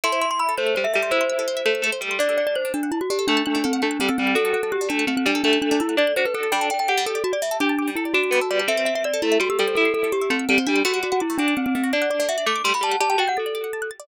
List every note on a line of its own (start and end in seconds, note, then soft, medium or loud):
0.04 0.54 E4 medium
0.04 0.12 A4 medium
0.04 0.20 C6 medium
0.12 0.20 C5 medium
0.21 0.30 E5 medium
0.21 0.30 C6 medium
0.31 0.39 C6 medium
0.39 0.55 B5 medium
0.39 0.48 E6 medium
0.49 0.57 A4 medium
0.58 0.75 A3 medium
0.58 0.66 C5 medium
0.58 0.75 C5 medium
0.67 0.75 E5 medium
0.75 0.86 G3 medium
0.75 0.84 C5 medium
0.75 0.84 C6 medium
0.84 0.93 E5 medium
0.84 0.93 E6 medium
0.94 1.13 G3 medium
0.94 1.02 A4 medium
0.94 1.11 E5 medium
1.03 1.11 C5 medium
1.11 1.62 E4 loud
1.11 1.85 C5 medium
1.11 1.20 E5 medium
1.21 1.29 C6 medium
1.30 1.38 E6 medium
1.39 1.47 A4 medium
1.48 1.56 C5 medium
1.57 1.65 E5 medium
1.66 1.82 A3 medium
1.66 1.74 C6 medium
1.75 1.83 E6 medium
1.82 1.91 A3 medium
1.82 1.92 A4 medium
1.92 2.01 C5 medium
2.01 2.18 G3 medium
2.01 2.10 E5 medium
2.11 2.19 C6 medium
2.19 2.69 D4 medium
2.19 2.28 D4 medium
2.19 2.36 D5 medium
2.29 2.37 A4 medium
2.38 2.46 D5 medium
2.38 2.46 F#5 medium
2.47 2.55 D5 medium
2.47 2.55 A5 medium
2.55 2.72 C5 medium
2.55 2.64 F#6 medium
2.65 2.73 D4 medium
2.74 2.91 D4 medium
2.74 2.82 A4 medium
2.83 2.91 F#5 medium
2.92 3.00 E4 medium
2.92 3.00 A5 medium
3.01 3.10 F#4 medium
3.01 3.09 F#6 medium
3.10 3.18 D4 medium
3.10 3.27 G4 medium
3.19 3.27 A4 medium
3.27 3.73 A3 medium
3.27 3.43 D4 medium
3.27 3.36 F#5 medium
3.37 3.45 A5 medium
3.46 3.55 D4 medium
3.46 3.54 F#6 medium
3.55 3.63 D4 medium
3.55 3.64 D4 medium
3.64 3.82 C4 medium
3.64 3.72 A4 medium
3.73 3.81 F#5 medium
3.82 3.97 A3 medium
3.82 4.00 D4 medium
3.82 3.90 A5 medium
3.91 3.99 F#6 medium
4.00 4.09 G3 medium
4.00 4.08 C4 medium
4.00 4.08 D4 medium
4.09 4.18 C4 medium
4.09 4.17 A4 medium
4.18 4.35 G3 medium
4.18 4.35 C4 medium
4.18 4.26 F#5 medium
4.27 4.35 A5 medium
4.35 4.44 D4 medium
4.35 4.86 F#4 loud
4.35 4.52 A4 medium
4.45 4.53 A4 medium
4.53 4.62 A4 medium
4.53 4.62 F#5 medium
4.63 4.72 A4 medium
4.63 4.71 A5 medium
4.72 4.88 G4 medium
4.72 4.80 F#6 medium
4.81 4.89 D4 medium
4.89 5.06 A3 medium
4.89 5.05 D4 medium
4.89 4.98 A4 medium
4.99 5.07 F#5 medium
5.07 5.16 A3 medium
5.07 5.16 C4 medium
5.07 5.16 A5 medium
5.17 5.25 C4 medium
5.17 5.25 F#6 medium
5.26 5.42 G3 medium
5.26 5.34 D4 medium
5.26 5.42 D4 medium
5.35 5.43 A4 medium
5.44 5.95 A3 loud
5.44 5.59 D4 medium
5.44 5.52 F#5 medium
5.53 5.61 A5 medium
5.62 5.70 D4 medium
5.62 5.70 F#6 medium
5.71 5.79 D4 medium
5.71 5.80 D4 medium
5.80 5.96 E4 medium
5.80 5.88 A4 medium
5.89 5.97 F#5 medium
5.97 6.12 D4 medium
5.97 6.14 D5 medium
5.97 6.07 A5 medium
6.07 6.15 F#6 medium
6.16 6.24 D4 medium
6.16 6.26 F#4 medium
6.16 6.25 C5 medium
6.25 6.34 A4 medium
6.25 6.34 B4 medium
6.34 6.50 A4 medium
6.34 6.52 A4 medium
6.34 6.43 F#5 medium
6.43 6.51 A5 medium
6.52 6.60 G3 medium
6.52 6.70 D4 loud
6.52 6.67 G5 medium
6.61 6.69 A4 medium
6.70 6.78 D5 medium
6.70 6.79 G5 medium
6.79 6.88 G5 medium
6.79 6.87 A5 medium
6.88 7.19 G4 medium
6.88 7.05 F#5 medium
6.88 6.96 D6 medium
6.98 7.06 G3 medium
7.06 7.23 A4 medium
7.06 7.15 A4 medium
7.15 7.23 D5 medium
7.24 7.32 F#4 medium
7.24 7.32 A5 medium
7.33 7.41 D5 medium
7.33 7.41 D6 medium
7.42 7.50 G3 medium
7.42 7.57 E5 medium
7.51 7.59 A4 medium
7.60 7.90 D4 medium
7.60 8.09 G4 medium
7.60 7.68 D5 medium
7.69 7.77 A5 medium
7.79 7.87 D6 medium
7.88 7.96 G3 medium
7.95 8.13 E4 medium
7.95 8.05 A4 medium
8.05 8.13 D5 medium
8.14 8.31 D4 medium
8.14 8.61 F#4 medium
8.14 8.23 A5 medium
8.23 8.32 D6 medium
8.31 8.40 G3 medium
8.31 8.39 B3 medium
8.41 8.50 A4 medium
8.51 8.67 G3 medium
8.51 8.59 D5 medium
8.59 8.68 A5 medium
8.68 9.20 C4 medium
8.68 8.76 A4 loud
8.68 8.84 E5 medium
8.77 8.86 C5 medium
8.85 8.94 E5 medium
8.95 9.04 E5 medium
8.95 9.04 C6 medium
9.04 9.21 D5 medium
9.04 9.12 E6 medium
9.14 9.22 A4 medium
9.22 9.38 A3 medium
9.22 9.39 E4 medium
9.22 9.30 C5 medium
9.32 9.40 E5 medium
9.40 9.48 G3 medium
9.40 9.49 F#4 medium
9.40 9.49 C6 medium
9.50 9.58 G4 medium
9.50 9.58 E6 medium
9.59 9.76 G3 medium
9.59 9.67 A4 medium
9.59 9.75 A4 medium
9.68 9.76 C5 medium
9.75 10.21 E4 medium
9.75 9.93 A4 medium
9.75 9.85 E5 medium
9.85 9.93 C6 medium
9.94 10.03 A4 medium
9.94 10.03 E6 medium
10.03 10.12 A4 medium
10.12 10.30 G4 medium
10.12 10.20 C5 medium
10.22 10.30 E5 medium
10.30 10.45 A3 medium
10.30 10.47 C4 medium
10.30 10.39 C6 medium
10.39 10.48 E6 medium
10.49 10.58 G3 medium
10.49 10.58 C4 medium
10.49 10.57 A4 medium
10.58 10.67 C4 medium
10.58 10.66 C5 medium
10.67 10.83 G3 medium
10.67 10.82 D4 medium
10.67 10.75 E5 medium
10.76 10.84 C6 medium
10.85 10.93 A3 loud
10.85 11.20 F#4 medium
10.85 11.00 F#4 medium
10.94 11.02 F#4 medium
11.03 11.12 F#4 medium
11.03 11.11 D5 medium
11.12 11.21 F#4 medium
11.12 11.20 F#5 medium
11.20 11.38 E4 medium
11.20 11.28 D6 medium
11.30 11.38 A3 medium
11.38 11.55 D4 medium
11.38 11.69 D4 medium
11.38 11.47 F#4 medium
11.48 11.56 D5 medium
11.57 11.66 C4 medium
11.57 11.65 F#5 medium
11.66 11.75 C4 medium
11.66 11.74 D6 medium
11.75 11.83 A3 medium
11.75 11.92 C4 medium
11.84 11.92 F#4 medium
11.93 12.42 D4 medium
11.93 12.01 D5 medium
11.93 12.09 D5 medium
12.02 12.10 F#5 medium
12.10 12.19 D5 medium
12.10 12.19 D6 medium
12.20 12.28 A3 medium
12.20 12.28 D5 medium
12.29 12.37 F#4 medium
12.29 12.45 E5 medium
12.38 12.46 D5 medium
12.46 12.61 A3 medium
12.46 12.55 F#5 medium
12.46 12.63 D6 medium
12.56 12.64 D6 medium
12.64 12.73 G3 medium
12.64 12.73 A3 medium
12.64 12.73 C6 medium
12.74 12.82 F#4 medium
12.74 12.83 B5 medium
12.81 12.96 G3 medium
12.81 12.91 D5 medium
12.81 12.98 A5 medium
12.92 13.00 F#5 medium
13.00 13.16 G4 medium
13.00 13.09 D5 loud
13.00 13.09 A5 medium
13.10 13.18 G5 medium
13.10 13.19 A5 medium
13.18 13.34 F#4 medium
13.18 13.28 G5 medium
13.18 13.27 A5 medium
13.28 13.37 F#5 medium
13.28 13.36 G6 medium
13.37 13.90 A4 medium
13.37 13.45 A6 medium
13.46 13.54 D5 medium
13.55 13.63 D5 medium
13.64 13.72 F#5 medium
13.73 13.81 A5 medium
13.82 13.90 F#6 medium
13.91 13.99 A6 medium
14.00 14.07 D5 medium